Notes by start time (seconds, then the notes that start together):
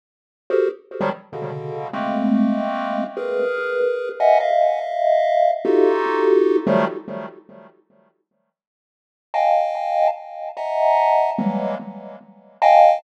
0.50 F#4 G4 G#4 A4 A#4 C5
1.01 D#3 F3 F#3 G3
1.33 B2 C#3 D3
1.93 G#3 A3 A#3 C4
3.17 G#4 A#4 B4
4.20 D#5 E5 F#5 G#5
4.40 D#5 E5 F5
5.65 D#4 F4 F#4 G4 A4
6.67 D#3 F3 F#3 G3 A3
9.34 D#5 F5 G5 G#5 A5
10.57 D#5 E5 F#5 G#5 A5 A#5
11.38 E3 F#3 G3 G#3 A#3
12.62 D#5 F5 G5 G#5 A5